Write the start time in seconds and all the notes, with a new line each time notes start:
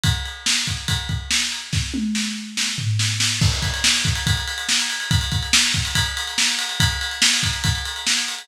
0.03 kick, ride
0.25 ride
0.46 snare
0.67 kick, ride
0.88 kick, ride
1.09 kick, ride
1.31 snare
1.52 ride
1.73 kick, snare
1.94 high tom
2.15 snare
2.57 snare
2.78 floor tom
2.99 snare
3.20 snare
3.41 kick, crash
3.52 ride
3.62 kick, ride
3.74 ride
3.84 snare
3.95 ride
4.05 kick, ride
4.15 ride
4.27 kick, ride
4.37 ride
4.47 ride
4.58 ride
4.69 snare
4.79 ride
4.90 ride
5.00 ride
5.11 kick, ride
5.21 ride
5.32 kick, ride
5.42 ride
5.53 snare
5.64 ride
5.74 kick, ride
5.85 ride
5.95 kick, ride
6.06 ride
6.17 ride
6.27 ride
6.38 snare
6.48 ride
6.59 ride
6.69 ride
6.80 kick, ride
6.90 ride
7.01 ride
7.11 ride
7.22 snare
7.33 ride
7.43 kick, ride
7.53 ride
7.64 kick, ride
7.75 ride
7.85 ride
7.96 ride
8.07 snare
8.17 ride
8.28 ride
8.38 ride